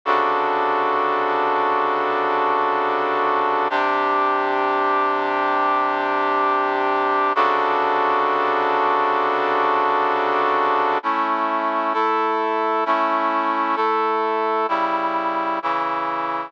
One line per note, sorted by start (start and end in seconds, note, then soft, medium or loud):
0.05 3.68 C3 medium
0.05 3.68 C#3 medium
0.05 3.68 D4 medium
0.05 3.68 F#4 medium
0.05 3.68 A4 medium
3.70 7.33 C3 medium
3.70 7.33 D4 medium
3.70 7.33 G4 medium
7.35 10.98 C3 medium
7.35 10.98 C#3 medium
7.35 10.98 D4 medium
7.35 10.98 F#4 medium
7.35 10.98 A4 medium
11.03 11.93 A3 medium
11.03 11.94 C#4 medium
11.03 11.93 E4 medium
11.94 12.84 A3 medium
11.94 12.84 E4 medium
11.94 12.84 A4 medium
12.86 13.75 A3 medium
12.86 13.76 C#4 medium
12.86 13.75 E4 medium
13.76 14.67 A3 medium
13.76 14.67 E4 medium
13.76 14.67 A4 medium
14.68 15.59 C#3 medium
14.68 15.59 G3 medium
14.68 15.59 E4 medium
15.62 16.52 C#3 medium
15.62 16.52 E3 medium
15.62 16.52 E4 medium